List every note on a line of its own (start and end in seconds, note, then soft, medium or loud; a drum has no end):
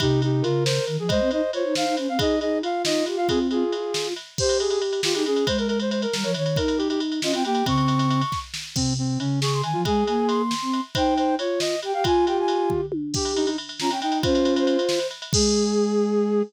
0.00 0.42 C3 loud
0.00 0.22 D#4 medium
0.00 0.20 G4 loud
0.00 kick medium
0.00 ride medium
0.22 0.44 D#4 medium
0.22 0.43 G4 medium
0.22 ride medium
0.42 0.79 C#3 medium
0.42 0.64 F4 loud
0.42 0.96 A#4 medium
0.42 ride medium
0.65 0.85 C5 medium
0.65 snare medium
0.87 0.98 D#3 medium
0.87 ride soft
0.98 1.09 F3 medium
0.98 1.10 G#4 medium
1.08 1.20 G#3 medium
1.08 1.31 C5 loud
1.08 1.29 D#5 loud
1.08 kick medium
1.08 ride medium
1.21 1.31 C4 medium
1.31 1.42 D#4 loud
1.31 1.51 C5 medium
1.31 1.51 D#5 medium
1.31 ride medium
1.53 1.64 F4 medium
1.53 2.08 C5 medium
1.53 1.74 C#5 medium
1.53 ride medium
1.64 1.75 D#4 medium
1.75 1.85 D#4 medium
1.75 1.95 F5 medium
1.75 snare medium
1.86 1.96 D#4 medium
1.97 2.08 C#4 medium
1.97 ride medium
2.08 2.18 C4 medium
2.08 2.19 F5 medium
2.18 2.39 D#4 medium
2.18 2.36 G#4 loud
2.18 2.40 D#5 medium
2.18 kick medium
2.18 ride medium
2.40 2.61 D#4 medium
2.40 2.59 G#4 medium
2.40 2.58 D#5 medium
2.40 ride soft
2.61 3.25 F4 medium
2.61 2.82 F5 medium
2.61 ride medium
2.85 3.03 D#4 medium
2.85 3.05 D#5 medium
2.85 snare medium
3.06 3.17 G4 medium
3.06 ride medium
3.17 3.28 F4 medium
3.17 3.27 F5 medium
3.26 3.64 C4 medium
3.26 3.47 F4 loud
3.26 3.39 G#4 loud
3.26 kick medium
3.26 ride medium
3.51 4.09 F4 loud
3.51 4.08 G#4 medium
3.51 ride medium
3.72 4.14 F4 medium
3.72 ride medium
3.94 snare medium
4.16 ride medium
4.38 5.01 G4 loud
4.38 4.58 C5 loud
4.38 kick medium
4.38 crash medium
4.49 ride medium
4.60 4.70 G#4 medium
4.60 ride medium
4.70 4.80 G#4 medium
4.70 ride medium
4.82 ride medium
4.93 ride medium
5.03 5.13 F4 medium
5.03 5.14 F4 medium
5.03 5.14 G4 medium
5.03 snare loud
5.14 5.25 D#4 loud
5.14 5.24 G4 medium
5.14 5.24 G#4 medium
5.14 ride medium
5.25 5.45 C#4 medium
5.25 5.44 G#4 medium
5.25 5.47 G#4 medium
5.25 ride medium
5.36 ride medium
5.47 6.06 G#3 medium
5.47 5.57 C5 medium
5.47 kick medium
5.47 ride medium
5.58 5.68 A#4 medium
5.58 ride medium
5.68 5.78 A#4 medium
5.68 ride medium
5.80 5.90 C5 medium
5.80 ride medium
5.91 6.01 C5 medium
5.91 ride medium
6.02 6.31 A#4 medium
6.02 ride medium
6.13 6.24 G3 medium
6.13 6.24 A#4 medium
6.13 snare medium
6.23 6.34 F3 medium
6.23 6.33 C#5 medium
6.23 ride medium
6.34 6.56 D#3 medium
6.34 6.58 C#5 medium
6.34 ride medium
6.46 ride medium
6.56 7.20 D#4 medium
6.56 6.78 A#4 medium
6.56 kick medium
6.56 ride medium
6.68 ride medium
6.78 6.88 G4 medium
6.78 ride medium
6.90 7.00 G4 medium
6.90 ride medium
7.00 ride medium
7.12 ride medium
7.22 7.33 C#4 medium
7.22 7.32 F4 medium
7.22 7.33 D#5 medium
7.22 snare medium
7.32 7.44 C4 medium
7.32 7.43 F4 medium
7.32 7.44 G5 medium
7.32 ride medium
7.45 7.63 A#3 medium
7.45 7.65 G4 medium
7.45 7.65 G5 loud
7.45 ride medium
7.55 ride medium
7.66 8.24 C#3 medium
7.66 8.22 C4 loud
7.66 8.39 C#6 loud
7.66 kick medium
7.66 ride medium
7.78 ride medium
7.88 ride medium
7.99 ride medium
8.10 ride medium
8.21 ride medium
8.32 kick medium
8.32 snare medium
8.54 snare medium
8.75 9.17 C3 medium
8.75 8.93 C4 medium
8.75 kick medium
8.75 crash medium
8.98 9.19 C4 medium
9.19 9.62 C#3 medium
9.19 9.40 C#4 medium
9.19 ride medium
9.41 9.61 G#4 medium
9.41 9.53 C#6 medium
9.41 snare medium
9.53 9.64 C6 medium
9.63 9.74 D#3 medium
9.63 9.81 G#5 medium
9.63 ride medium
9.73 9.85 F3 medium
9.73 9.83 F4 medium
9.85 10.04 G#3 loud
9.85 10.42 G#4 loud
9.85 10.04 G#5 loud
9.85 kick medium
9.85 ride medium
10.07 10.54 A#3 medium
10.07 10.27 G#5 medium
10.07 ride medium
10.27 10.81 C6 medium
10.27 ride medium
10.51 snare medium
10.62 10.80 C4 medium
10.73 ride medium
10.95 11.36 D#4 loud
10.95 11.14 C5 medium
10.95 11.35 G5 loud
10.95 kick medium
10.95 ride medium
11.18 11.35 C5 medium
11.18 ride medium
11.39 11.75 F4 medium
11.39 11.60 C#5 medium
11.39 ride medium
11.60 11.80 D#5 medium
11.60 snare medium
11.82 11.93 G4 medium
11.82 11.94 G5 medium
11.82 ride medium
11.94 12.04 G4 medium
11.94 12.04 F5 medium
11.94 12.05 G5 medium
12.04 12.81 F4 medium
12.04 12.26 F4 loud
12.04 12.25 G#5 loud
12.04 kick medium
12.04 ride medium
12.26 12.86 G4 medium
12.26 12.37 G5 medium
12.26 ride medium
12.40 12.70 G#5 medium
12.48 ride medium
12.70 kick medium
12.70 floor tom medium
12.92 high tom medium
13.14 13.49 G4 loud
13.14 13.33 G4 medium
13.14 kick medium
13.14 crash medium
13.25 ride medium
13.35 13.46 D#4 medium
13.35 ride medium
13.46 13.57 D#4 medium
13.46 ride medium
13.58 ride medium
13.69 ride medium
13.80 13.90 C#4 medium
13.80 13.90 F4 medium
13.80 13.91 A#5 loud
13.80 snare medium
13.90 14.01 C#4 medium
13.90 14.00 G5 medium
13.90 ride medium
14.00 14.21 D#4 medium
14.00 14.22 D#4 medium
14.00 14.18 G5 loud
14.00 ride medium
14.12 ride medium
14.22 14.77 C#4 loud
14.22 14.99 F4 medium
14.22 14.54 C5 loud
14.22 kick medium
14.22 ride medium
14.35 ride medium
14.45 ride medium
14.56 15.07 C5 loud
14.56 ride medium
14.67 ride medium
14.79 ride medium
14.89 snare medium
14.99 ride medium
15.11 ride medium
15.22 ride medium
15.33 16.42 G#3 loud
15.33 16.43 G#4 loud
15.33 kick loud
15.33 crash loud